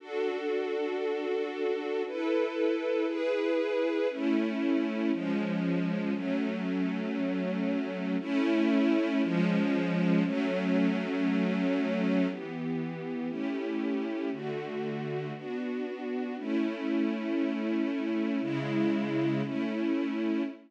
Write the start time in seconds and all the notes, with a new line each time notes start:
0.00 D4 F#4 A4
2.06 E4 A4 B4
3.07 E4 G#4 B4
4.10 A3 C#4 E4
5.12 F3 G#3 C#4
6.13 F#3 A3 C#4
8.20 A3 C#4 E4
9.22 F3 G#3 C#4
10.24 F#3 A3 C#4
12.28 E3 B3 G4
13.28 A3 C#4 E4 G4
14.31 D3 A3 F#4
15.34 B3 D4 F#4
16.38 A3 C#4 E4
18.41 C#3 G#3 E4
19.43 A3 C#4 E4